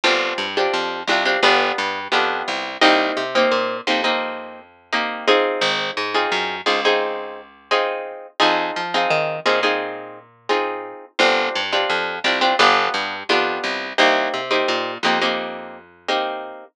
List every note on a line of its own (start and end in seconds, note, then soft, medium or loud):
0.04 0.33 G1 medium
0.04 0.46 C4 medium
0.04 0.46 D4 medium
0.04 0.46 F4 medium
0.04 0.46 G4 medium
0.38 0.68 G2 medium
0.57 0.99 C4 medium
0.57 0.99 D4 medium
0.57 0.99 F4 medium
0.57 0.99 G4 medium
0.74 1.03 F2 medium
1.07 1.37 C2 medium
1.07 1.23 C4 medium
1.07 1.23 D4 medium
1.07 1.23 F4 medium
1.07 1.23 G4 medium
1.25 1.39 C4 medium
1.25 1.39 D4 medium
1.25 1.39 F4 medium
1.25 1.39 G4 medium
1.43 1.72 G1 medium
1.43 1.99 B3 medium
1.43 1.99 D4 medium
1.43 1.99 F4 medium
1.43 1.99 G4 medium
1.78 2.08 G2 medium
2.12 2.43 F2 medium
2.12 2.68 B3 medium
2.12 2.68 D4 medium
2.12 2.68 F4 medium
2.12 2.68 G4 medium
2.48 2.77 C2 medium
2.81 3.12 C2 medium
2.81 3.23 A#3 medium
2.81 3.23 C4 loud
2.81 3.23 D#4 loud
2.81 3.23 G4 medium
3.17 3.46 C3 medium
3.35 3.77 A#3 medium
3.35 3.77 C4 medium
3.35 3.77 D#4 medium
3.35 3.77 G4 medium
3.51 3.81 A#2 medium
3.87 5.36 F2 medium
3.87 4.01 A#3 medium
3.87 4.01 C4 medium
3.87 4.01 D#4 medium
3.87 4.01 G4 medium
4.04 4.60 A#3 medium
4.04 4.60 C4 medium
4.04 4.60 D#4 medium
4.04 4.60 G4 medium
4.93 5.26 A#3 medium
4.93 5.26 C4 medium
4.93 5.26 D#4 medium
4.93 5.26 G4 medium
5.27 6.04 C4 medium
5.27 6.04 D#4 medium
5.27 6.04 F4 medium
5.27 6.04 G#4 medium
5.61 5.91 G#1 medium
5.97 6.27 G#2 medium
6.14 6.56 C4 medium
6.14 6.56 D#4 medium
6.14 6.56 F4 medium
6.14 6.56 G#4 medium
6.32 6.61 F#2 medium
6.66 8.15 C#2 medium
6.66 6.80 C4 medium
6.66 6.80 D#4 medium
6.66 6.80 F4 medium
6.66 6.80 G#4 medium
6.85 7.41 C4 medium
6.85 7.41 D#4 medium
6.85 7.41 F4 medium
6.85 7.41 G#4 medium
7.71 8.27 C4 medium
7.71 8.27 D#4 medium
7.71 8.27 F4 medium
7.71 8.27 G#4 medium
8.40 8.71 F2 medium
8.40 8.82 C4 medium
8.40 8.82 D#4 medium
8.40 8.82 F4 medium
8.40 8.82 G#4 medium
8.76 9.06 F3 medium
8.94 9.36 C4 medium
8.94 9.36 D#4 medium
8.94 9.36 F4 medium
8.94 9.36 G#4 medium
9.10 9.40 D#3 medium
9.45 10.94 A#2 medium
9.45 9.60 C4 medium
9.45 9.60 D#4 medium
9.45 9.60 F4 medium
9.45 9.60 G#4 medium
9.63 10.19 C4 medium
9.63 10.19 D#4 medium
9.63 10.19 F4 medium
9.63 10.19 G#4 medium
10.49 11.05 C4 medium
10.49 11.05 D#4 medium
10.49 11.05 F4 medium
10.49 11.05 G#4 medium
11.19 11.49 G1 medium
11.19 11.61 C4 medium
11.19 11.61 D4 medium
11.19 11.61 F4 medium
11.19 11.61 G4 medium
11.55 11.85 G2 medium
11.73 12.14 C4 medium
11.73 12.14 D4 medium
11.73 12.14 F4 medium
11.73 12.14 G4 medium
11.90 12.19 F2 medium
12.24 12.54 C2 medium
12.24 12.38 C4 medium
12.24 12.38 D4 medium
12.24 12.38 F4 medium
12.24 12.38 G4 medium
12.41 12.55 C4 medium
12.41 12.55 D4 medium
12.41 12.55 F4 medium
12.41 12.55 G4 medium
12.59 12.89 G1 medium
12.59 13.15 B3 medium
12.59 13.15 D4 medium
12.59 13.15 F4 medium
12.59 13.15 G4 medium
12.94 13.23 G2 medium
13.29 13.59 F2 medium
13.29 13.85 B3 medium
13.29 13.85 D4 medium
13.29 13.85 F4 medium
13.29 13.85 G4 medium
13.64 13.93 C2 medium
13.98 14.28 C2 medium
13.98 14.40 A#3 medium
13.98 14.40 C4 medium
13.98 14.40 D#4 medium
13.98 14.40 G4 medium
14.34 14.63 C3 medium
14.51 14.92 A#3 medium
14.51 14.92 C4 medium
14.51 14.92 D#4 medium
14.51 14.92 G4 medium
14.68 14.98 A#2 medium
15.03 16.51 F2 medium
15.03 15.19 A#3 medium
15.03 15.19 C4 medium
15.03 15.19 D#4 medium
15.03 15.19 G4 medium
15.22 15.77 A#3 medium
15.22 15.77 C4 medium
15.22 15.77 D#4 medium
15.22 15.77 G4 medium
16.08 16.64 A#3 medium
16.08 16.64 C4 medium
16.08 16.64 D#4 medium
16.08 16.64 G4 medium